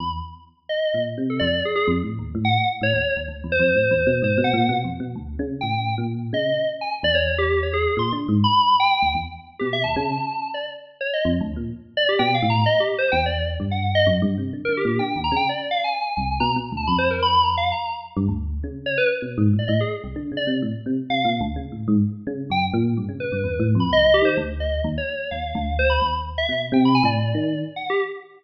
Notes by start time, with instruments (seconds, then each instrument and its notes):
0.00 electric piano 1 E2, electric piano 2 B5
0.69 electric piano 2 D#5
0.94 electric piano 1 A#2
1.17 electric piano 1 C3
1.30 electric piano 2 A4
1.39 electric piano 1 F2, electric piano 2 D5
1.65 electric piano 2 G#4
1.75 electric piano 2 G#4
1.87 electric piano 1 F2
2.03 electric piano 1 A2
2.19 electric piano 1 D#2
2.35 electric piano 1 A2
2.45 electric piano 2 F#5
2.81 electric piano 1 A2, electric piano 2 C#5
2.93 electric piano 1 D#2
3.16 electric piano 1 D#2
3.28 electric piano 1 D2
3.44 electric piano 1 E2
3.52 electric piano 2 C5
3.59 electric piano 1 F2
3.75 electric piano 1 A2
3.91 electric piano 1 E2
4.06 electric piano 1 B2
4.22 electric piano 1 G#2, electric piano 2 C5
4.38 electric piano 1 B2
4.44 electric piano 2 F#5
4.53 electric piano 1 A#2
4.69 electric piano 1 B2
4.84 electric piano 1 F2
5.00 electric piano 1 B2
5.15 electric piano 1 D2
5.39 electric piano 1 C#3
5.61 electric piano 1 A2, electric piano 2 G5
5.98 electric piano 1 A#2
6.33 electric piano 1 C#3, electric piano 2 D#5
6.81 electric piano 2 G#5
7.03 electric piano 1 E2, electric piano 2 D5
7.15 electric piano 2 C#5
7.38 electric piano 2 G4
7.63 electric piano 2 C#5
7.73 electric piano 2 G#4
7.97 electric piano 1 A#2, electric piano 2 C6
8.12 electric piano 1 D3
8.28 electric piano 1 G#2
8.44 electric piano 2 B5
8.80 electric piano 2 G5
9.02 electric piano 1 D2
9.14 electric piano 1 E2
9.59 electric piano 1 B2, electric piano 2 G4
9.73 electric piano 2 E5
9.84 electric piano 1 D#2, electric piano 2 A5
9.96 electric piano 1 C#3
10.54 electric piano 2 D5
11.01 electric piano 2 C#5
11.13 electric piano 2 D#5
11.25 electric piano 1 F2
11.41 electric piano 1 D2
11.56 electric piano 1 A#2
11.97 electric piano 2 D5
12.09 electric piano 2 G4
12.19 electric piano 1 B2, electric piano 2 G5
12.34 electric piano 2 F5
12.42 electric piano 1 A2
12.50 electric piano 2 A#5
12.66 electric piano 2 D#5
12.80 electric piano 2 G4
12.98 electric piano 2 C5
13.12 electric piano 1 E2, electric piano 2 G5
13.26 electric piano 2 D5
13.60 electric piano 1 G2
13.71 electric piano 2 F#5
13.95 electric piano 2 D#5
14.06 electric piano 1 F#2
14.22 electric piano 1 G2
14.38 electric piano 1 C3
14.53 electric piano 1 D3
14.65 electric piano 1 D3, electric piano 2 A#4
14.77 electric piano 2 G4
14.85 electric piano 1 A#2
14.99 electric piano 1 D3, electric piano 2 G5
15.16 electric piano 1 D#2
15.24 electric piano 2 A#5
15.31 electric piano 1 C#3
15.36 electric piano 2 G5
15.49 electric piano 2 D5
15.71 electric piano 2 F5
15.84 electric piano 2 G#5
16.17 electric piano 1 C2
16.40 electric piano 1 B2, electric piano 2 A#5
16.56 electric piano 1 B2
16.72 electric piano 1 D2
16.77 electric piano 2 A5
16.87 electric piano 1 F2, electric piano 2 B5
16.98 electric piano 2 C5
17.10 electric piano 2 A#4
17.22 electric piano 2 B5
17.44 electric piano 2 A#5
17.57 electric piano 2 F5
17.72 electric piano 2 A#5
18.16 electric piano 1 G2
18.28 electric piano 1 D2
18.63 electric piano 1 C#3
18.86 electric piano 2 C#5
18.98 electric piano 2 B4
19.22 electric piano 1 B2
19.38 electric piano 1 G#2
19.53 electric piano 1 A2
19.59 electric piano 2 D5
19.68 electric piano 1 A2, electric piano 2 D#5
19.80 electric piano 2 G#4
20.04 electric piano 1 C2
20.16 electric piano 1 D3
20.32 electric piano 1 C#3
20.37 electric piano 2 D5
20.47 electric piano 1 C3
20.62 electric piano 1 A2
20.86 electric piano 1 C3
21.09 electric piano 1 C3, electric piano 2 F5
21.25 electric piano 1 A#2
21.41 electric piano 1 D2
21.56 electric piano 1 C#3
21.72 electric piano 1 A2
21.88 electric piano 1 G#2
22.27 electric piano 1 C#3
22.50 electric piano 1 F#2, electric piano 2 G5
22.73 electric piano 1 A#2
22.97 electric piano 1 G2
23.09 electric piano 1 C#3
23.20 electric piano 2 B4
23.32 electric piano 1 G2
23.44 electric piano 1 E2
23.59 electric piano 1 A2
23.75 electric piano 1 F2
23.80 electric piano 2 B5
23.91 electric piano 1 C2, electric piano 2 D#5
24.06 electric piano 1 C2
24.14 electric piano 2 G4
24.22 electric piano 1 D#3, electric piano 2 C5
24.37 electric piano 1 D2
24.60 electric piano 2 D#5
24.84 electric piano 1 D#2
24.98 electric piano 2 C#5
25.31 electric piano 1 D#2, electric piano 2 F5
25.55 electric piano 1 D2
25.79 electric piano 2 C5
25.90 electric piano 2 B5
26.02 electric piano 1 D#2
26.38 electric piano 2 E5
26.48 electric piano 1 B2
26.72 electric piano 1 C3, electric piano 2 G5
26.85 electric piano 2 B5
26.95 electric piano 2 G#5
27.03 electric piano 1 A2, electric piano 2 D5
27.34 electric piano 1 D#3
27.76 electric piano 2 F#5
27.90 electric piano 2 G4